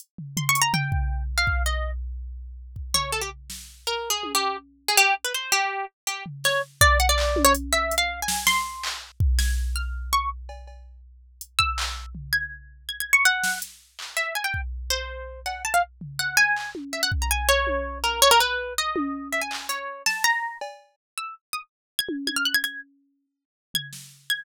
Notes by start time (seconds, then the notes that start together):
0.00 closed hi-hat
0.18 floor tom
0.37 C6, floor tom
0.49 C#6
0.55 closed hi-hat
0.62 A#5
0.74 G5, floor tom
0.92 kick
1.38 F5
1.47 kick
1.66 D#5
2.76 kick
2.94 C#5, floor tom
3.12 A4
3.21 G4
3.50 snare
3.87 A#4
4.10 G#4
4.23 high tom
4.35 G4
4.88 G#4
4.97 G4
5.24 B4
5.34 C5
5.52 G4
6.07 G4, closed hi-hat
6.26 floor tom
6.44 C#5, snare
6.81 D5, kick
7.00 F#5
7.09 D5
7.18 clap
7.36 high tom
7.45 C#5
7.55 closed hi-hat
7.73 E5
7.91 closed hi-hat
7.98 F5
8.22 G#5
8.28 snare
8.47 C6, snare
8.83 clap
9.20 kick
9.39 G#6, snare
9.76 F6
10.13 C#6
10.49 cowbell
10.67 cowbell
11.41 closed hi-hat
11.59 E6, kick
11.78 clap
12.15 floor tom
12.33 G#6
12.89 G#6
13.00 G#6
13.13 C#6
13.25 F#5
13.44 snare
13.62 closed hi-hat
13.99 clap
14.17 E5
14.35 G#5
14.44 G5
14.54 kick
14.90 C5
15.46 F#5, cowbell
15.65 A5
15.74 F5
16.01 floor tom
16.19 F#5
16.37 G#5
16.56 clap
16.75 high tom
16.93 E5
17.03 F#5
17.12 kick
17.22 A#5
17.31 G#5
17.49 C#5
17.67 high tom
18.04 A#4
18.22 C#5
18.31 A#4
18.40 B4
18.78 D#5
18.96 high tom
19.33 E5
19.41 G#5
19.51 clap
19.69 C#5, closed hi-hat
20.06 A5, snare
20.24 A#5
20.61 cowbell
21.18 E6
21.53 D#6
21.99 G#6
22.09 high tom
22.27 G#6, high tom
22.36 F6
22.45 F#6
22.54 G#6
22.64 G#6, closed hi-hat
23.74 G#6, floor tom
23.93 snare
24.30 G#6